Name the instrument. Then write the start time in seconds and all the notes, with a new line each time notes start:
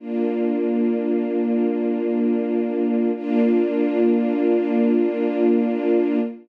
string ensemble 1
0.00 A#3 D4 F4
3.16 A#3 D4 F4